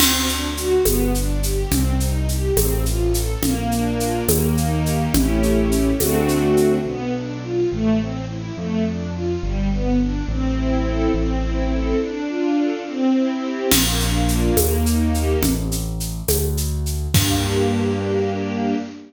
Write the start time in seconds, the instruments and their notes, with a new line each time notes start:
0.00 acoustic grand piano D2, string ensemble 1 C4, crash, low conga, shaker
0.28 string ensemble 1 D4, shaker
0.56 string ensemble 1 F#4, shaker
0.84 acoustic grand piano G1, string ensemble 1 B3, tambourine, high conga, shaker
1.14 string ensemble 1 D4, shaker
1.43 string ensemble 1 G4, shaker
1.71 acoustic grand piano C2, string ensemble 1 C4, low conga, shaker
2.00 string ensemble 1 D#4, shaker
2.28 string ensemble 1 G4, shaker
2.56 acoustic grand piano A1, string ensemble 1 C4, tambourine, high conga, shaker
2.84 string ensemble 1 F4, shaker
3.14 string ensemble 1 A4, shaker
3.42 acoustic grand piano A#1, string ensemble 1 A#3, low conga, shaker
3.71 string ensemble 1 D4, shaker
3.98 string ensemble 1 F4, shaker
4.28 acoustic grand piano D#2, string ensemble 1 A#3, tambourine, high conga, shaker
4.56 string ensemble 1 D#4, shaker
4.86 string ensemble 1 G4, shaker
5.14 acoustic grand piano A1, string ensemble 1 A3 C#4 E4 G4, low conga, shaker
5.43 shaker
5.72 shaker
5.99 acoustic grand piano D2, string ensemble 1 A3 C4 D4 F#4, tambourine, high conga, shaker
6.28 shaker
6.57 shaker
6.86 acoustic grand piano B1, string ensemble 1 B3
7.15 string ensemble 1 D4
7.43 string ensemble 1 F4
7.72 acoustic grand piano A1, string ensemble 1 A3
8.00 string ensemble 1 C4
8.29 string ensemble 1 E4
8.57 acoustic grand piano F2, string ensemble 1 A3
8.86 string ensemble 1 D4
9.15 string ensemble 1 F4
9.43 acoustic grand piano G1, string ensemble 1 G3
9.72 string ensemble 1 B3
10.00 string ensemble 1 D4
10.28 acoustic grand piano A1, string ensemble 1 C4
10.57 string ensemble 1 E4
10.86 string ensemble 1 A4
11.13 acoustic grand piano A1, string ensemble 1 C4
11.43 string ensemble 1 E4
11.70 string ensemble 1 A4
12.00 string ensemble 1 D4
12.28 string ensemble 1 F4
12.56 string ensemble 1 A4
12.86 string ensemble 1 C4
13.15 string ensemble 1 E4
13.42 string ensemble 1 G4
13.71 acoustic grand piano A#1, string ensemble 1 A#3, crash, low conga, shaker
13.99 string ensemble 1 D4, shaker
14.28 string ensemble 1 F4, shaker
14.57 acoustic grand piano D#2, string ensemble 1 A#3, tambourine, high conga, shaker
14.85 string ensemble 1 D#4, shaker
15.13 string ensemble 1 G4, shaker
15.43 acoustic grand piano A1, low conga, shaker
15.72 shaker
16.00 shaker
16.28 acoustic grand piano D2, tambourine, high conga, shaker
16.57 shaker
16.86 shaker
17.14 acoustic grand piano G2, string ensemble 1 A#3 D4 G4, kick, crash